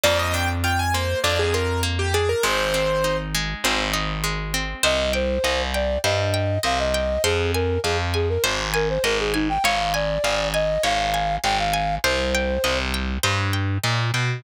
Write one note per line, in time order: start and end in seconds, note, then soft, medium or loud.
0.04 1.15 F2 loud
0.04 0.94 A#3 medium
0.04 0.18 D5 medium
0.19 0.34 D#5 medium
0.34 1.24 D4 medium
0.34 0.48 G5 medium
0.64 1.54 F4 medium
0.64 0.79 G5 medium
0.79 0.94 G#5 medium
0.94 1.82 A#3 medium
0.94 1.19 C5 medium
1.24 2.34 F2 medium
1.24 2.14 D4 medium
1.24 1.38 D5 medium
1.39 1.54 G#4 medium
1.54 2.40 F4 medium
1.54 1.81 A#4 medium
1.83 2.40 A#3 medium
1.99 2.13 G4 medium
2.14 2.43 D4 medium
2.14 2.29 G#4 medium
2.29 2.43 A#4 medium
2.43 3.54 G#1 loud
2.43 3.34 G#3 medium
2.43 3.17 C5 medium
2.74 3.64 C4 medium
3.04 3.93 D#4 medium
3.35 4.23 G#3 medium
3.64 4.75 G#1 loud
3.64 4.54 C4 medium
3.94 4.79 D#4 medium
4.24 4.81 G#3 medium
4.54 4.83 C4 medium
4.83 5.38 C2 loud
4.83 5.10 C5 medium
4.83 5.12 D#5 medium
5.13 5.62 C5 medium
5.13 5.40 G5 medium
5.44 5.98 C2 medium
5.44 5.71 D#5 medium
5.74 5.98 D5 medium
5.74 6.01 G5 medium
6.04 6.58 G2 medium
6.04 6.31 C5 medium
6.04 6.59 D#5 medium
6.34 6.61 G5 medium
6.63 7.18 C2 medium
6.63 6.90 D#5 medium
6.63 6.79 F5 medium
6.79 7.23 D#5 medium
6.94 7.21 G5 medium
7.24 7.78 F2 medium
7.24 7.52 G#4 medium
7.24 7.51 C5 medium
7.54 7.80 A#4 medium
7.54 7.82 G#5 medium
7.84 8.38 F2 medium
7.84 7.98 G#4 medium
7.84 8.12 F5 medium
8.14 8.29 G#4 medium
8.14 8.41 G#5 medium
8.29 8.43 A#4 medium
8.44 8.98 G#1 loud
8.44 8.71 C5 loud
8.74 8.88 A#4 medium
8.74 9.01 G#5 medium
8.89 9.04 C5 medium
9.04 9.58 G#1 medium
9.04 9.18 A#4 medium
9.04 9.31 D#5 medium
9.19 9.34 G#4 medium
9.34 9.48 D#4 medium
9.34 9.61 G#5 medium
9.49 9.63 G5 medium
9.64 10.18 G#1 loud
9.64 9.92 C#5 medium
9.64 9.93 F5 medium
9.94 10.48 D5 medium
9.94 10.21 G#5 medium
10.24 10.78 G#1 medium
10.24 10.51 F5 medium
10.54 10.83 D#5 medium
10.54 10.81 G#5 medium
10.84 11.38 G#1 medium
10.84 11.11 C#5 medium
10.84 11.36 F5 medium
11.14 11.41 G#5 medium
11.44 11.98 G#1 medium
11.44 11.71 F5 medium
11.44 11.58 G5 medium
11.59 11.95 F5 medium
11.73 12.01 G#5 medium
12.04 12.58 C2 medium
12.04 12.78 C5 medium
12.04 12.31 C5 medium
12.35 12.62 G5 medium
12.64 13.18 C2 medium
12.64 12.91 D#5 medium
12.94 13.21 G5 medium
13.23 13.78 G2 medium
13.23 13.50 C5 medium
13.53 13.80 G5 medium
13.84 14.11 A#2 medium
13.84 14.11 D#5 medium
14.14 14.41 B2 medium
14.14 14.41 G5 medium